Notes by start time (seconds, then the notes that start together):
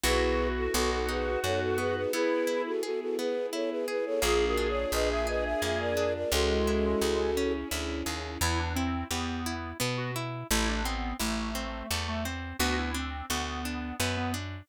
0.03 B1 B3 E4 F#4 G#4 B4
0.57 F#4 A4
0.73 B1 B3 D#4 F#4 A4
0.91 F#4 A4
1.08 D#4 G#4 B4
1.43 F#2 F#4 A4 C#5
1.61 F#4 A4
1.78 B3 G#4 B4
1.96 G#4 B4
2.13 B3 E4 G#4 B4
2.47 E4
2.66 F#4 A4
2.83 F#4 G#4 A4
3.01 F#4 A4
3.18 B3 G#4 B4
3.53 E4 A4 C#5
3.70 G#4 B4
3.88 G#4 B4
4.06 A4 C#5
4.22 A#1 A#3 D4 F4 G#4
4.46 F#4 A#4
4.57 D4
4.69 C#5
4.92 A#1 F4 B4 D#5
5.10 E5
5.27 G#4 B4 D#5
5.44 E5
5.62 F2 A#3 E5
5.80 A#4 D5
5.97 D4
6.15 A#4 D5
6.32 C#2 G#3 C#4 E4 F#4 G#4 A4
6.67 E4
7.01 C#2 G#4
7.37 C#4
7.71 D2 E4
8.06 D#2 G#4
8.41 E2 B3 E4
8.59 D4
8.75 C4 E4
9.10 E2 B3 G4
9.46 E4
9.80 B2 B3
9.97 F#4
10.16 E4
10.51 A1 A3 E4
10.68 D4
10.84 B3 C4
11.19 A1 A3 E4
11.55 C4
11.91 E2 A3
12.08 A3
12.25 C4
12.59 D2 B3 F#4
12.78 E4
12.94 C4 D4
13.30 D2 B3 F#4
13.65 D4
14.00 F#2 B3
14.17 B3
14.34 D4